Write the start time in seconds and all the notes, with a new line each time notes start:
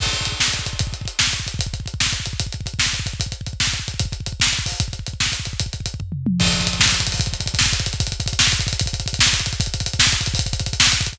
0.00 kick, crash
0.07 kick
0.13 kick, closed hi-hat
0.21 kick
0.25 kick, closed hi-hat
0.32 kick
0.40 kick, snare
0.48 kick
0.54 kick, closed hi-hat
0.59 kick
0.66 kick, closed hi-hat
0.73 kick
0.79 kick, closed hi-hat
0.87 kick
0.93 kick, closed hi-hat
1.01 kick
1.05 kick, closed hi-hat
1.19 kick, snare
1.27 kick
1.33 kick, closed hi-hat
1.40 kick
1.47 kick, closed hi-hat
1.54 kick
1.59 kick, closed hi-hat
1.66 kick
1.74 kick, closed hi-hat
1.80 kick
1.86 kick, closed hi-hat
1.94 kick
2.00 kick, snare
2.06 kick
2.13 kick, closed hi-hat
2.20 kick
2.26 kick, closed hi-hat
2.33 kick
2.40 kick, closed hi-hat
2.46 kick
2.53 kick, closed hi-hat
2.61 kick
2.66 kick, closed hi-hat
2.74 kick
2.79 kick, snare
2.86 kick
2.93 kick, closed hi-hat
3.00 kick
3.06 kick, closed hi-hat
3.13 kick
3.20 kick, closed hi-hat
3.26 kick
3.32 kick, closed hi-hat
3.41 kick
3.46 kick, closed hi-hat
3.53 kick
3.60 kick, snare
3.67 kick
3.73 kick, closed hi-hat
3.80 kick
3.88 kick, closed hi-hat
3.94 kick
4.00 kick, closed hi-hat
4.05 kick
4.12 kick, closed hi-hat
4.20 kick
4.26 kick, closed hi-hat
4.32 kick
4.40 kick, snare
4.47 kick
4.53 kick, closed hi-hat
4.59 kick
4.66 kick, open hi-hat
4.72 kick
4.80 kick, closed hi-hat
4.88 kick
4.93 kick, closed hi-hat
4.99 kick
5.07 kick, closed hi-hat
5.13 kick
5.20 kick, snare
5.26 kick
5.32 kick, closed hi-hat
5.40 kick
5.45 kick, closed hi-hat
5.53 kick
5.60 kick, closed hi-hat
5.66 kick
5.73 kick, closed hi-hat
5.80 kick
5.86 kick, closed hi-hat
5.94 kick
6.00 kick, floor tom
6.12 mid tom
6.26 high tom
6.40 kick, crash
6.46 kick, closed hi-hat
6.53 kick, closed hi-hat
6.60 kick, closed hi-hat
6.67 kick, closed hi-hat
6.73 kick, closed hi-hat
6.80 kick, snare
6.86 kick, closed hi-hat
6.92 kick, closed hi-hat
7.00 kick, closed hi-hat
7.07 kick, closed hi-hat
7.12 kick, open hi-hat
7.20 kick, closed hi-hat
7.26 kick, closed hi-hat
7.33 kick, closed hi-hat
7.40 kick, closed hi-hat
7.46 kick, closed hi-hat
7.54 kick, closed hi-hat
7.59 kick, snare
7.66 kick, closed hi-hat
7.73 kick, closed hi-hat
7.80 kick, closed hi-hat
7.86 kick, closed hi-hat
7.93 kick, closed hi-hat
8.00 kick, closed hi-hat
8.07 kick, closed hi-hat
8.12 kick, closed hi-hat
8.20 kick, closed hi-hat
8.26 kick, closed hi-hat
8.33 kick, closed hi-hat
8.39 kick, snare
8.47 kick, closed hi-hat
8.52 kick, closed hi-hat
8.60 kick, closed hi-hat
8.67 kick, closed hi-hat
8.73 kick, closed hi-hat
8.80 kick, closed hi-hat
8.86 kick, closed hi-hat
8.93 kick, closed hi-hat
9.00 kick, closed hi-hat
9.06 kick, closed hi-hat
9.13 kick, closed hi-hat
9.19 kick, snare
9.26 kick, closed hi-hat
9.33 kick, closed hi-hat
9.40 kick, closed hi-hat
9.46 kick, closed hi-hat
9.53 kick, closed hi-hat
9.60 kick, closed hi-hat
9.66 kick, closed hi-hat
9.74 kick, closed hi-hat
9.80 kick, closed hi-hat
9.86 kick, closed hi-hat
9.93 kick, closed hi-hat
9.99 kick, snare
10.06 kick, closed hi-hat
10.12 kick, closed hi-hat
10.21 kick, closed hi-hat
10.26 kick, closed hi-hat
10.34 kick, open hi-hat
10.39 kick, closed hi-hat
10.46 kick, closed hi-hat
10.53 kick, closed hi-hat
10.60 kick, closed hi-hat
10.66 kick, closed hi-hat
10.73 kick, closed hi-hat
10.80 kick, snare
10.86 kick, closed hi-hat
10.92 kick, closed hi-hat
11.01 kick, closed hi-hat
11.06 kick, closed hi-hat
11.13 kick, closed hi-hat